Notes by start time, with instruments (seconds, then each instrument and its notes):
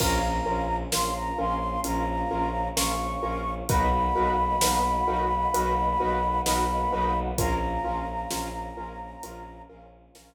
0.00 violin A#1, choir aahs A#3 C#4 F4, acoustic grand piano C#4 F4 A#4, flute A#5, kick, crash
0.46 violin A#1, acoustic grand piano C#4 F4 A#4
0.92 violin A#1, acoustic grand piano C#4 F4 A#4, flute C6, snare
1.16 flute A#5
1.38 violin A#1, acoustic grand piano C#4 F4 A#4, flute C6
1.84 violin A#1, acoustic grand piano C#4 F4 A#4, flute A#5, closed hi-hat
2.30 violin A#1, acoustic grand piano C#4 F4 A#4
2.76 violin A#1, acoustic grand piano C#4 F4 A#4, flute C#6, snare
3.23 violin A#1, acoustic grand piano C#4 F4 A#4
3.69 violin B1, choir aahs A#3 B3 D#4 F#4, acoustic grand piano D#4 F#4 A#4 B4, flute B5, kick, closed hi-hat
4.16 violin B1, acoustic grand piano D#4 F#4 A#4 B4
4.61 violin B1, acoustic grand piano D#4 F#4 A#4 B4, snare
5.07 violin B1, acoustic grand piano D#4 F#4 A#4 B4
5.54 violin B1, acoustic grand piano D#4 F#4 A#4 B4, closed hi-hat
6.00 violin B1, acoustic grand piano D#4 F#4 A#4 B4
6.46 violin B1, acoustic grand piano D#4 F#4 A#4 B4, flute B5, snare
6.93 violin B1, acoustic grand piano D#4 F#4 A#4 B4
7.38 violin A#1, choir aahs A#3 C#4 F4, acoustic grand piano C#4 F4 A#4, flute A#5, kick, closed hi-hat
7.84 violin A#1, acoustic grand piano C#4 F4 A#4
8.31 violin A#1, acoustic grand piano C#4 F4 A#4, snare
8.76 violin A#1, acoustic grand piano C#4 F4 A#4
9.23 violin A#1, acoustic grand piano C#4 F4 A#4, closed hi-hat
9.69 violin A#1, acoustic grand piano C#4 F4 A#4
10.15 violin A#1, acoustic grand piano C#4 F4 A#4, snare